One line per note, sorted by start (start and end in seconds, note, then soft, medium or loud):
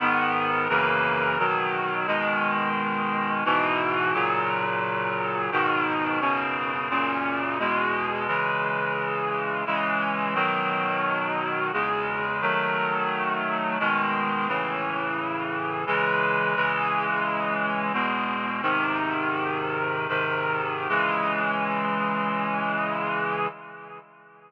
0.00 0.68 G#2 loud
0.00 0.68 D#3 loud
0.00 0.68 B3 loud
0.69 1.37 F#2 loud
0.69 1.37 C#3 medium
0.69 1.37 E3 loud
0.69 1.37 A#3 loud
1.39 2.06 B2 medium
1.39 2.06 D#3 medium
1.39 2.07 F#3 medium
2.07 3.43 B2 medium
2.07 3.43 D#3 loud
2.07 3.43 G#3 medium
3.45 4.13 G#2 medium
3.45 4.13 B2 loud
3.45 4.13 E3 loud
4.14 5.50 A#2 loud
4.14 5.50 C#3 medium
4.14 5.50 F#3 loud
5.52 6.20 G#2 loud
5.52 6.20 B2 loud
5.52 6.20 D#3 loud
6.21 6.89 F#2 medium
6.21 6.89 B2 medium
6.21 6.89 C#3 loud
6.90 7.58 F#2 medium
6.90 7.58 A#2 loud
6.90 7.58 C#3 medium
7.59 8.27 E2 medium
7.59 8.27 B2 medium
7.59 8.27 G#3 loud
8.27 9.64 C#3 loud
8.27 9.64 E3 medium
8.27 9.64 G#3 medium
9.66 10.34 C#3 medium
9.66 10.34 E3 medium
9.66 10.34 G#3 medium
10.34 11.71 B2 loud
10.34 11.71 D#3 loud
10.34 11.71 F#3 medium
11.73 12.41 E2 medium
11.73 12.41 C#3 medium
11.73 12.41 G#3 medium
12.41 13.78 D#3 medium
12.41 13.78 F#3 loud
12.41 13.78 A3 medium
13.79 14.48 B2 medium
13.79 14.48 D#3 medium
13.79 14.48 G#3 medium
14.48 15.85 A2 medium
14.48 15.85 C#3 medium
14.48 15.85 E3 medium
15.87 16.55 C#3 medium
15.87 16.55 E3 loud
15.87 16.55 G#3 loud
16.56 17.92 C#3 medium
16.56 17.92 E3 medium
16.56 17.92 G#3 loud
17.93 18.61 E2 medium
17.93 18.61 B2 medium
17.93 18.61 G#3 medium
18.62 20.07 G#2 medium
18.62 20.07 C3 medium
18.62 20.07 D#3 loud
20.09 20.88 G#2 medium
20.09 20.88 C3 medium
20.09 20.88 D#3 medium
20.89 23.47 C#3 medium
20.89 23.47 E3 loud
20.89 23.47 G#3 medium